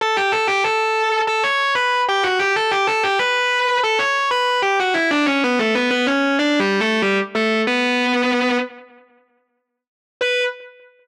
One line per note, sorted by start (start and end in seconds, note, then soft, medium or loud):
0.01 0.16 A4 medium
0.01 0.16 A5 loud
0.16 0.32 G4 medium
0.16 0.32 G5 medium
0.32 0.47 A4 medium
0.32 0.47 A5 medium
0.47 0.63 G4 medium
0.47 0.63 G5 medium
0.64 1.21 A4 medium
0.64 1.21 A5 medium
1.27 1.42 A4 medium
1.27 1.42 A5 medium
1.43 1.73 C#5 medium
1.43 1.73 C#6 medium
1.75 2.01 B4 medium
1.75 2.01 B5 medium
2.09 2.24 G4 medium
2.09 2.24 G5 medium
2.23 2.39 F#4 medium
2.23 2.39 F#5 medium
2.39 2.54 G4 medium
2.39 2.54 G5 medium
2.56 2.71 A4 medium
2.56 2.71 A5 medium
2.71 2.86 G4 medium
2.71 2.86 G5 medium
2.87 3.02 A4 medium
2.87 3.02 A5 medium
3.03 3.18 G4 medium
3.03 3.18 G5 medium
3.19 3.79 B4 medium
3.19 3.79 B5 medium
3.83 3.99 A4 medium
3.83 3.99 A5 medium
3.99 4.29 C#5 medium
3.99 4.29 C#6 medium
4.31 4.58 B4 medium
4.31 4.58 B5 loud
4.62 4.78 G4 medium
4.62 4.78 G5 medium
4.80 4.95 F#4 medium
4.80 4.95 F#5 medium
4.94 5.09 E4 medium
4.94 5.09 E5 loud
5.11 5.26 D4 medium
5.11 5.26 D5 medium
5.26 5.41 C#4 medium
5.26 5.41 C#5 medium
5.44 5.59 B3 medium
5.44 5.59 B4 medium
5.59 5.74 A3 medium
5.59 5.74 A4 medium
5.75 5.90 B3 medium
5.75 5.90 B4 medium
5.91 6.06 B3 medium
5.91 6.06 B4 medium
6.07 6.36 C#4 medium
6.07 6.36 C#5 medium
6.39 6.59 D4 medium
6.39 6.59 D5 medium
6.60 6.80 G3 medium
6.60 6.80 G4 medium
6.80 7.01 A3 medium
6.80 7.01 A4 medium
7.02 7.17 G3 medium
7.02 7.17 G4 medium
7.35 7.61 A3 medium
7.35 7.61 A4 medium
7.67 8.57 B3 medium
7.67 8.57 B4 loud
10.21 10.43 B4 loud